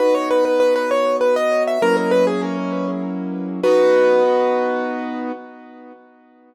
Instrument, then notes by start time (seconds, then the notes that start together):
acoustic grand piano
0.00 B3 D#4 F#4 B4
0.15 C#5
0.31 B4
0.45 B4
0.60 B4
0.76 B4
0.91 C#5
1.21 B4
1.36 D#5
1.67 E5
1.82 F#3 A#3 C#4 E4 A#4
1.97 A#4
2.11 B4
2.27 G#4
2.42 C#4
3.63 B3 D#4 F#4 B4